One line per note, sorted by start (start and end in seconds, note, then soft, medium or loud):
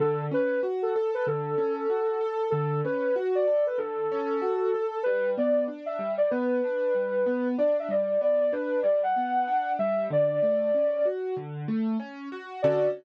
0.00 0.29 D3 loud
0.00 0.25 A4 loud
0.31 0.60 C#4 medium
0.31 0.61 B4 loud
0.63 0.92 F#4 medium
0.83 1.11 A4 medium
0.96 1.25 A4 medium
1.14 1.26 B4 medium
1.27 1.56 D3 medium
1.27 2.44 A4 medium
1.58 1.87 C#4 medium
1.90 2.19 F#4 medium
2.21 2.50 A4 medium
2.50 2.81 D3 medium
2.50 2.80 A4 loud
2.85 3.14 C#4 medium
2.85 3.15 B4 medium
3.16 3.45 F#4 medium
3.35 3.64 D5 medium
3.48 3.77 A4 medium
3.67 3.79 B4 medium
3.78 4.07 D3 medium
3.78 4.98 A4 loud
4.12 4.41 C#4 medium
4.42 4.71 F#4 medium
4.74 5.03 A4 medium
5.03 5.35 G3 loud
5.03 5.30 B4 loud
5.38 5.67 B3 medium
5.38 5.65 D5 loud
5.68 5.97 D4 medium
5.86 6.12 E5 medium
5.99 6.28 G3 medium
6.18 6.30 D5 medium
6.31 6.61 B3 loud
6.31 7.48 B4 medium
6.64 6.93 D4 medium
6.95 7.24 G3 medium
7.26 7.55 B3 medium
7.58 7.88 D4 medium
7.58 7.76 D5 medium
7.79 7.91 E5 medium
7.89 8.18 G3 medium
7.89 8.20 D5 medium
8.21 8.50 B3 medium
8.21 8.39 D5 medium
8.41 8.53 D5 loud
8.52 8.82 D4 medium
8.52 8.80 B4 loud
8.83 9.13 G3 medium
8.83 9.01 D5 medium
9.03 9.72 F#5 loud
9.16 9.45 B3 medium
9.47 9.76 D4 medium
9.79 10.08 G3 medium
9.79 10.06 E5 loud
10.10 10.39 D3 loud
10.10 11.06 D5 loud
10.42 10.71 A3 medium
10.74 11.03 C#4 medium
11.05 11.34 F#4 medium
11.37 11.66 D3 medium
11.68 11.97 A3 medium
12.00 12.29 C#4 medium
12.32 12.61 F#4 medium
12.62 12.88 D3 loud
12.62 12.88 C#4 medium
12.62 12.88 F#4 loud
12.62 12.88 A4 loud
12.62 12.87 D5 loud